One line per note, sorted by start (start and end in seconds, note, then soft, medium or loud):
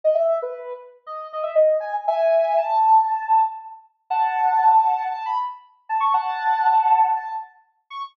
0.04 0.16 D#5 medium
0.15 0.38 E5 medium
0.42 0.73 B4 medium
1.07 1.27 D#5 medium
1.33 1.45 D#5 medium
1.43 1.55 E5 medium
1.55 1.77 D#5 medium
1.80 1.92 G#5 medium
2.08 2.56 E5 medium
2.08 2.56 G#5 medium
2.58 3.39 A5 medium
4.10 5.04 F#5 medium
4.10 5.04 A5 medium
5.11 5.23 A5 medium
5.26 5.38 B5 medium
5.89 6.01 A5 medium
6.00 6.12 C#6 medium
6.14 7.06 F#5 medium
6.14 7.06 A5 medium
7.16 7.28 A5 medium
7.90 8.02 C#6 medium